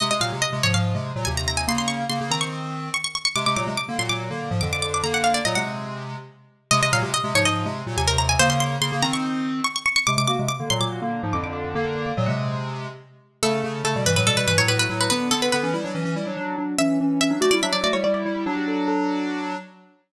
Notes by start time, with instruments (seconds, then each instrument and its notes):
0.00 lead 1 (square) C3 G#3, harpsichord D#5
0.11 lead 1 (square) C3 G#3, harpsichord D#5
0.20 lead 1 (square) A#2 F#3, harpsichord F5
0.32 lead 1 (square) C3 G#3
0.42 harpsichord D#5
0.52 lead 1 (square) C3 G#3
0.63 lead 1 (square) G#2 F3, harpsichord C#5
0.74 lead 1 (square) G#2 F3, harpsichord F5
0.94 lead 1 (square) C3 G#3
1.16 lead 1 (square) A#2 F#3
1.25 lead 1 (square) D#2 C3, harpsichord G#5
1.37 harpsichord A#5
1.48 harpsichord A#5
1.57 harpsichord G#5
1.67 lead 1 (square) C#3 A#3, harpsichord C6
1.78 harpsichord C6
1.88 harpsichord C#6
2.09 lead 1 (square) C#3 A#3, harpsichord C6
2.21 lead 1 (square) C#3 A#3
2.30 lead 1 (square) D#3 C4, harpsichord A#5
2.41 harpsichord C#6
2.94 harpsichord C#6
3.04 harpsichord C#6
3.15 harpsichord C#6
3.25 harpsichord C#6
3.36 lead 1 (square) C3 G#3, harpsichord D6
3.46 lead 1 (square) C3 G#3, harpsichord D6
3.56 lead 1 (square) A#2 F#3, harpsichord D6
3.67 lead 1 (square) C3 G#3
3.77 harpsichord D6
3.88 lead 1 (square) D3 A#3
3.98 lead 1 (square) A#2 F#3, harpsichord C6
4.09 lead 1 (square) A#2 F#3, harpsichord D6
4.30 lead 1 (square) D3 A#3
4.51 lead 1 (square) G#2 F3
4.61 lead 1 (square) F2 D3, harpsichord D6
4.73 harpsichord D6
4.82 harpsichord D6
4.94 harpsichord D6
5.03 lead 1 (square) D3 A#3, harpsichord A#5
5.14 harpsichord F#5
5.24 harpsichord F5
5.34 harpsichord D5
5.45 lead 1 (square) A#2 F#3, harpsichord D#5
5.55 lead 1 (square) C3 G#3, harpsichord F#5
6.71 lead 1 (square) C3 G#3, harpsichord D#5
6.82 lead 1 (square) C3 G#3, harpsichord D#5
6.92 lead 1 (square) A#2 F#3, harpsichord F5
7.02 lead 1 (square) C3 G#3
7.14 harpsichord D#5
7.24 lead 1 (square) C3 G#3
7.34 lead 1 (square) G#2 F3, harpsichord C#5
7.45 lead 1 (square) G#2 F3, harpsichord D#5
7.65 lead 1 (square) C3 G#3
7.86 lead 1 (square) A#2 F#3
7.97 lead 1 (square) D#2 C3, harpsichord G#5
8.08 harpsichord A#4
8.18 harpsichord A#5
8.29 harpsichord G#5
8.39 lead 1 (square) C#3 A#3, harpsichord C5
8.50 harpsichord C6
8.60 harpsichord C6
8.81 lead 1 (square) C#3 A#3, harpsichord C6
8.92 lead 1 (square) C#3 A#3
9.02 lead 1 (square) D#3 C4, harpsichord A#5
9.13 harpsichord C#6
9.64 harpsichord C#6
9.76 harpsichord C#6
9.86 harpsichord C#6
9.96 harpsichord C#6
10.07 lead 1 (square) C3 G#3, harpsichord D6
10.17 lead 1 (square) C3 G#3, harpsichord D6
10.27 lead 1 (square) A#3 F#4, harpsichord D6
10.39 lead 1 (square) C3 G#3
10.49 harpsichord D6
10.60 lead 1 (square) D3 A#3
10.70 lead 1 (square) A#2 F#3, harpsichord C6
10.81 lead 1 (square) A#2 F#3, harpsichord D6
11.01 lead 1 (square) D3 A#3
11.23 lead 1 (square) G#2 F3
11.33 lead 1 (square) F2 D3, harpsichord D6
11.44 harpsichord D6
11.53 harpsichord D6
11.64 harpsichord D6
11.75 lead 1 (square) D3 A#3, harpsichord A#5
11.85 harpsichord F#5
11.96 harpsichord F5
12.06 harpsichord D6
12.17 lead 1 (square) A#2 F#3, harpsichord D#5
12.26 lead 1 (square) C3 G#3, harpsichord F#5
13.43 lead 1 (square) C#3 A3, harpsichord A4
13.64 lead 1 (square) C#3 A3
13.84 lead 1 (square) C#3 A3, harpsichord A4
13.96 lead 1 (square) B2 G3
14.06 lead 1 (square) G2 E3, harpsichord B4
14.16 lead 1 (square) A2 F#3, harpsichord B4
14.26 lead 1 (square) B2 G3, harpsichord A4
14.37 lead 1 (square) B2 G3, harpsichord B4
14.47 lead 1 (square) G2 E3, harpsichord B4
14.58 lead 1 (square) A2 F#3, harpsichord C#5
14.68 lead 1 (square) A2 F#3, harpsichord B4
14.79 harpsichord B4
14.89 lead 1 (square) A2 F#3
15.01 harpsichord B4
15.10 lead 1 (square) D3 B3, harpsichord B4
15.31 lead 1 (square) D3 B3, harpsichord A4
15.42 harpsichord B4
15.52 lead 1 (square) D3 B3, harpsichord B4
15.63 lead 1 (square) E3 C#4
15.73 lead 1 (square) G3 E4
15.84 lead 1 (square) F#3 D4
15.94 lead 1 (square) E3 C#4
16.05 lead 1 (square) E3 C#4
16.16 lead 1 (square) G3 E4
16.26 lead 1 (square) F#3 D4
16.37 lead 1 (square) F#3 D4
16.58 lead 1 (square) F#3 D4
16.78 lead 1 (square) E3 C#4, harpsichord E5
17.00 lead 1 (square) E3 C#4
17.20 lead 1 (square) E3 C#4, harpsichord E5
17.30 lead 1 (square) F#3 D4
17.40 lead 1 (square) A3 F#4, harpsichord D5
17.51 lead 1 (square) G3 E4, harpsichord D5
17.62 lead 1 (square) F#3 D4, harpsichord E5
17.73 lead 1 (square) F#3 D4, harpsichord D5
17.83 lead 1 (square) A3 F#4, harpsichord D5
17.93 lead 1 (square) G3 E4, harpsichord C#5
18.04 lead 1 (square) G3 E4, harpsichord D5
18.14 harpsichord D5
18.25 lead 1 (square) G3 E4
18.36 harpsichord D5
18.46 lead 1 (square) F#3 D4, harpsichord F#4
18.57 harpsichord G4
18.68 harpsichord A4
18.88 harpsichord A4